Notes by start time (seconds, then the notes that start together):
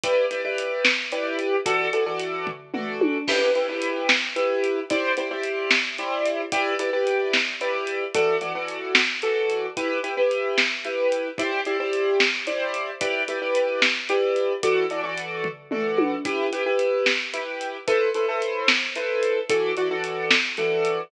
0.04 E4 G4 B4 D5, kick, closed hi-hat
0.31 E4 G4 B4 D5, closed hi-hat
0.45 E4 G4 B4 D5
0.58 closed hi-hat
0.85 snare
1.12 E4 G4 B4 D5, closed hi-hat
1.39 closed hi-hat
1.66 E3 F#4 A4 D5, kick, closed hi-hat
1.93 E3 F#4 A4 D5, closed hi-hat
2.06 E3 F#4 A4 D5
2.20 closed hi-hat
2.47 kick, floor tom
2.74 E3 F#4 A4 D5, mid tom
3.01 high tom
3.28 E4 G4 B4, kick, crash
3.55 E4 G4 B4, closed hi-hat
3.69 E4 G4 B4
3.82 closed hi-hat
4.09 snare
4.36 E4 G4 B4, closed hi-hat
4.64 closed hi-hat
4.90 E4 G4 C5 D5, kick, closed hi-hat
5.17 E4 G4 C5 D5, closed hi-hat
5.31 E4 G4 C5 D5
5.44 closed hi-hat
5.71 snare
5.98 E4 G4 C5 D5, closed hi-hat
6.26 closed hi-hat
6.52 E4 G4 B4 D5, kick, closed hi-hat
6.79 E4 G4 B4 D5, closed hi-hat
6.93 E4 G4 B4 D5
7.07 closed hi-hat
7.33 snare
7.61 E4 G4 B4 D5, closed hi-hat
7.87 closed hi-hat
8.14 E3 F#4 A4 D5, kick, closed hi-hat
8.41 E3 F#4 A4 D5, closed hi-hat
8.55 E3 F#4 A4 D5
8.68 closed hi-hat
8.95 snare
9.22 E3 F#4 A4 D5, closed hi-hat
9.50 closed hi-hat
9.77 E4 G4 B4, kick, closed hi-hat
10.03 E4 G4 B4, closed hi-hat
10.17 E4 G4 B4
10.31 closed hi-hat
10.58 snare
10.85 E4 G4 B4, closed hi-hat
11.12 closed hi-hat
11.38 E4 G4 C5 D5, kick, closed hi-hat
11.65 E4 G4 C5 D5, closed hi-hat
11.80 E4 G4 C5 D5
11.93 closed hi-hat
12.20 snare
12.47 E4 G4 C5 D5, closed hi-hat
12.74 closed hi-hat
13.01 E4 G4 B4 D5, kick, closed hi-hat
13.28 E4 G4 B4 D5, closed hi-hat
13.41 E4 G4 B4 D5
13.55 closed hi-hat
13.82 snare
14.09 E4 G4 B4 D5, closed hi-hat
14.36 closed hi-hat
14.63 E3 F#4 A4 D5, kick, closed hi-hat
14.90 E3 F#4 A4 D5, closed hi-hat
15.04 E3 F#4 A4 D5
15.18 closed hi-hat
15.44 kick, floor tom
15.71 E3 F#4 A4 D5, mid tom
15.98 high tom
16.25 E4 G4 B4, kick, closed hi-hat
16.52 E4 G4 B4, closed hi-hat
16.66 E4 G4 B4
16.79 closed hi-hat
17.06 snare
17.33 E4 G4 B4, closed hi-hat
17.61 closed hi-hat
17.87 E4 A4 B4 C5, kick, closed hi-hat
18.15 E4 A4 B4 C5, closed hi-hat
18.28 E4 A4 B4 C5
18.42 closed hi-hat
18.68 snare
18.96 E4 A4 B4 C5, closed hi-hat
19.23 closed hi-hat
19.50 E3 F#4 A4 D5, kick, closed hi-hat
19.77 E3 F#4 A4 D5, closed hi-hat
19.91 E3 F#4 A4 D5
20.04 closed hi-hat
20.31 snare
20.57 E3 F#4 A4 D5, closed hi-hat
20.85 closed hi-hat